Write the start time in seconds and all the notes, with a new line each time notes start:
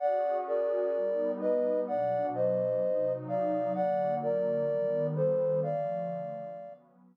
0.00 C#4 F#4 G#4 D5 F#5
0.47 A#4 D5
0.95 G3 B3 D#4
1.41 B4 D#5
1.88 B2 F#3 D4 D5 F#5
2.34 C5 D#5
2.82 C3 F#3 D#4
3.28 D5 F5
3.75 D3 F#3 A#3 D5 F#5
4.22 A#4 D5
4.69 D#3 G3 B3
5.16 A4 C5
5.63 D3 F3 A3 D5 F5
6.56 F#3 B3 C#4